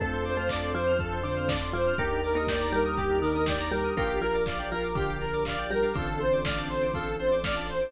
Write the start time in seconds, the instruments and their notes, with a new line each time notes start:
0.00 synth bass 2 F2, marimba A3 A4, pad 2 (warm) C4 D4 F4 A4, drawbar organ C4 D4 F4 A4, electric piano 2 A4, lead 2 (sawtooth) A4, kick, closed hi-hat
0.13 electric piano 2 C5
0.24 lead 2 (sawtooth) C5, electric piano 2 D5, open hi-hat
0.37 marimba A3 A4, electric piano 2 F5
0.49 lead 2 (sawtooth) D5, electric piano 2 A5, kick, clap
0.62 drawbar organ C4 D4 F4 A4, electric piano 2 C6
0.74 marimba F3 F4, lead 2 (sawtooth) C5, electric piano 2 D6, open hi-hat
0.87 electric piano 2 F6
0.99 drawbar organ C4 D4 F4 A4, electric piano 2 A4, lead 2 (sawtooth) A4, kick, closed hi-hat
1.12 electric piano 2 C5
1.23 marimba D3 D4, lead 2 (sawtooth) C5, electric piano 2 D5, open hi-hat
1.36 electric piano 2 F5
1.47 lead 2 (sawtooth) D5, electric piano 2 A5, kick, snare
1.61 electric piano 2 C6
1.73 marimba F3 F4, lead 2 (sawtooth) C5, electric piano 2 D6, open hi-hat
1.86 drawbar organ C4 D4 F4 A4, electric piano 2 F6
1.98 synth bass 2 D#2, marimba A#3 A#4, drawbar organ D4 D#4 G4 A#4, pad 2 (warm) D4 D#4 G4 A#4, electric piano 2 G4, lead 2 (sawtooth) G4, kick, closed hi-hat
2.11 electric piano 2 A#4
2.23 lead 2 (sawtooth) A#4, electric piano 2 D5, open hi-hat
2.35 marimba A#3 A#4, electric piano 2 D#5
2.47 lead 2 (sawtooth) D5, electric piano 2 G5, kick, snare
2.60 drawbar organ D4 D#4 G4 A#4, electric piano 2 A#5
2.72 marimba G3 G4, lead 2 (sawtooth) A#4, electric piano 2 D6, open hi-hat
2.85 electric piano 2 D#6
2.96 drawbar organ D4 D#4 G4 A#4, lead 2 (sawtooth) G4, electric piano 2 G4, kick, closed hi-hat
3.10 electric piano 2 A#4
3.22 marimba D#3 D#4, lead 2 (sawtooth) A#4, electric piano 2 D5, open hi-hat
3.35 electric piano 2 D#5
3.46 lead 2 (sawtooth) D5, electric piano 2 G5, kick, snare
3.59 electric piano 2 A#5
3.71 marimba G3 G4, lead 2 (sawtooth) A#4, electric piano 2 D6, open hi-hat
3.84 drawbar organ D4 D#4 G4 A#4, electric piano 2 D#6
3.97 synth bass 2 A#1, marimba A#3 A#4, pad 2 (warm) D4 F4 G4 A#4, drawbar organ D4 F4 G4 A#4, electric piano 2 F4, lead 2 (sawtooth) G4, kick, closed hi-hat
4.09 electric piano 2 G4
4.21 marimba F3 F4, lead 2 (sawtooth) A#4, electric piano 2 A#4, open hi-hat
4.34 electric piano 2 D5
4.46 lead 2 (sawtooth) D5, electric piano 2 F5, kick, clap
4.58 drawbar organ D4 F4 G4 A#4, electric piano 2 G5
4.71 marimba F3 F4, lead 2 (sawtooth) A#4, electric piano 2 A#5, open hi-hat
4.83 electric piano 2 D6
4.95 marimba D3 D4, drawbar organ D4 F4 G4 A#4, electric piano 2 F4, lead 2 (sawtooth) G4, kick, closed hi-hat
5.08 electric piano 2 G4
5.21 electric piano 2 A#4, lead 2 (sawtooth) A#4, open hi-hat
5.33 electric piano 2 D5
5.45 lead 2 (sawtooth) D5, electric piano 2 F5, kick, clap
5.58 electric piano 2 G5
5.70 marimba G3 G4, lead 2 (sawtooth) A#4, electric piano 2 A#5, open hi-hat
5.83 drawbar organ D4 F4 G4 A#4, electric piano 2 D6
5.93 synth bass 2 A1, marimba D3 D4, drawbar organ C4 D4 F4 A4, pad 2 (warm) C4 D4 F4 A4, electric piano 2 F4, lead 2 (sawtooth) A4, kick, closed hi-hat
6.07 electric piano 2 A4
6.20 electric piano 2 C5, lead 2 (sawtooth) C5, open hi-hat
6.32 electric piano 2 D5
6.44 lead 2 (sawtooth) D5, electric piano 2 F5, kick, snare
6.57 drawbar organ C4 D4 F4 A4, electric piano 2 A5
6.69 lead 2 (sawtooth) C5, electric piano 2 C6, open hi-hat
6.82 electric piano 2 D6
6.93 drawbar organ C4 D4 F4 A4, electric piano 2 F4, lead 2 (sawtooth) A4, kick, closed hi-hat
7.07 electric piano 2 A4
7.19 lead 2 (sawtooth) C5, electric piano 2 C5, open hi-hat
7.31 electric piano 2 D5
7.44 lead 2 (sawtooth) D5, electric piano 2 F5, kick, snare
7.56 electric piano 2 A5
7.68 lead 2 (sawtooth) C5, electric piano 2 C6, open hi-hat
7.81 drawbar organ C4 D4 F4 A4, electric piano 2 D6